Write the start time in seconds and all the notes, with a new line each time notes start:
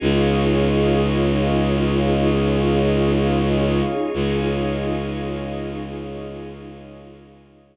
0.00 C#2 C#4 D#4 F4 G#4 C#5 D#5 F5
4.14 C#2 C#4 D#4 F4 G#4 C#5 D#5 F5